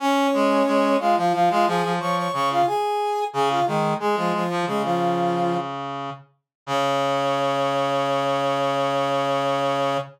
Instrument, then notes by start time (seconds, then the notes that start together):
brass section
0.00 C#4 C#5
0.33 G#3
0.67 G#3
1.00 G#3 F4 F5
1.17 F3 F4 F5
1.33 F3 F4 F5
1.50 G#3 F4 F5
1.67 F3 G#4 G#5
1.83 F3
2.00 F3 C#5 C#6
2.16 C#5 C#6
2.33 C#3 C#5 C#6
2.50 F4 F5
2.67 G#4 G#5
3.33 C#3 G#4 G#5
3.50 F4 F5
3.66 D#3 G#3 G#4
4.00 G#3 G#4
4.16 F3 F4
4.34 F3 F4
4.50 F3
4.66 C#3 G#3 G#4
4.83 F3 F4
6.67 C#3 C#5